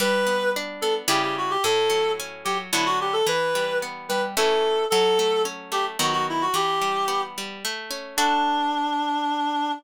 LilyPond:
<<
  \new Staff \with { instrumentName = "Clarinet" } { \time 3/4 \key d \major \tempo 4 = 110 b'4 r8 a'16 r16 g'16 g'16 fis'16 g'16 | a'4 r8 g'16 r16 e'16 fis'16 g'16 a'16 | b'4 r8 b'16 r16 a'4 | a'4 r8 g'16 r16 fis'16 fis'16 e'16 fis'16 |
g'4. r4. | d'2. | }
  \new Staff \with { instrumentName = "Orchestral Harp" } { \time 3/4 \key d \major g8 b8 d'8 b8 <cis g e'>4 | a,8 fis8 cis'8 fis8 <d fis b>4 | e8 g8 b8 g8 <e a cis'>4 | fis8 a8 cis'8 a8 <dis fis b>4 |
e8 g8 b8 g8 a8 cis'8 | <d' fis' a'>2. | }
>>